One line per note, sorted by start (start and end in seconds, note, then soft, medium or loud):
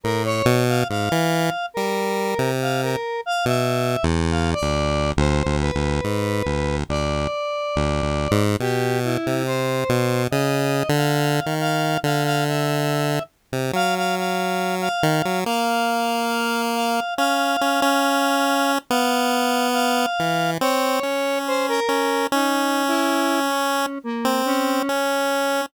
0.04 0.43 A2 medium
0.04 0.23 A#4 medium
0.25 0.64 C#5 medium
0.46 0.84 B2 loud
0.69 0.88 F5 medium
0.89 1.09 G#2 medium
0.89 1.66 F5 medium
1.12 1.50 E3 loud
1.74 2.35 G3 medium
1.74 2.51 A#4 medium
2.39 2.96 C3 medium
2.62 2.81 F5 medium
2.82 3.21 A#4 medium
3.26 3.45 F5 medium
3.46 3.97 B2 medium
3.46 4.05 E5 medium
4.03 4.55 E2 loud
4.31 4.51 F5 medium
4.53 5.11 D5 loud
4.62 5.13 D2 medium
5.17 5.43 D2 loud
5.17 5.56 C5 medium
5.46 5.71 D2 loud
5.61 6.77 B4 medium
5.75 6.01 D2 medium
6.04 6.43 G#2 medium
6.46 6.84 D2 medium
6.89 7.28 D2 medium
6.89 8.44 D5 medium
7.76 8.02 D2 medium
8.02 8.28 D2 medium
8.31 8.57 G#2 loud
8.60 9.18 B2 medium
8.60 8.99 G4 loud
9.04 9.43 E4 medium
9.27 9.84 C3 medium
9.46 10.23 C5 medium
9.89 10.28 B2 medium
10.31 10.83 C#3 loud
10.31 10.89 D#5 medium
10.89 11.41 D3 loud
10.96 11.54 F5 medium
11.46 11.98 D#3 medium
11.61 11.99 F5 medium
12.04 13.19 D3 medium
12.04 12.23 F5 medium
12.25 12.44 F5 loud
12.46 13.23 E5 medium
13.53 13.72 C3 medium
13.73 14.89 F#3 medium
13.73 13.95 F5 loud
13.96 14.15 F5 medium
14.17 14.75 F5 medium
14.81 15.39 F5 medium
15.03 15.22 D#3 medium
15.25 15.44 F#3 medium
15.46 17.00 A#3 medium
15.46 16.62 F5 medium
16.76 17.14 F5 medium
17.18 17.57 C#4 medium
17.18 18.72 F5 loud
17.61 17.81 C#4 medium
17.82 18.79 C#4 loud
18.91 20.06 B3 loud
18.91 19.68 F5 medium
19.73 20.51 F5 loud
20.19 20.58 E3 medium
20.61 21.00 C4 medium
20.61 21.39 C#5 loud
21.03 21.80 C#4 medium
21.47 21.67 C5 medium
21.68 22.26 A#4 loud
21.89 22.27 C#4 medium
22.32 23.86 C#4 loud
22.32 22.84 D#4 medium
22.88 23.40 E4 loud
23.47 23.99 C#4 medium
24.04 24.42 A#3 medium
24.25 24.83 C4 medium
24.46 25.61 C#4 loud
24.89 25.66 C#4 medium